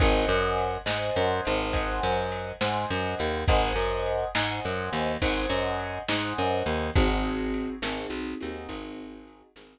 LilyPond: <<
  \new Staff \with { instrumentName = "Acoustic Grand Piano" } { \time 12/8 \key aes \major \tempo 4. = 69 <c'' ees'' ges'' aes''>4. <c'' ees'' ges'' aes''>4. <c'' ees'' ges'' aes''>4. <c'' ees'' ges'' aes''>4. | <c'' ees'' ges'' aes''>4. <c'' ees'' ges'' aes''>4. <c'' ees'' ges'' aes''>4. <c'' ees'' ges'' aes''>4. | <c' ees' ges' aes'>4. <c' ees' ges' aes'>4 <c' ees' ges' aes'>2 <c' ees' ges' aes'>4. | }
  \new Staff \with { instrumentName = "Electric Bass (finger)" } { \clef bass \time 12/8 \key aes \major aes,,8 ges,4 aes,8 ges,8 aes,,4 ges,4 aes,8 ges,8 ees,8 | aes,,8 ges,4 aes,8 ges,8 ees,8 aes,,8 ges,4 aes,8 ges,8 ees,8 | aes,,4. aes,,8 b,,8 ees,8 aes,,4. aes,,8 r4 | }
  \new DrumStaff \with { instrumentName = "Drums" } \drummode { \time 12/8 <bd cymr>4 cymr8 sn4 cymr8 <bd cymr>4 cymr8 sn4 cymr8 | <bd cymr>4 cymr8 sn4 cymr8 <bd cymr>4 cymr8 sn4 cymr8 | <bd cymr>4 cymr8 sn4 cymr8 <bd cymr>4 cymr8 sn4. | }
>>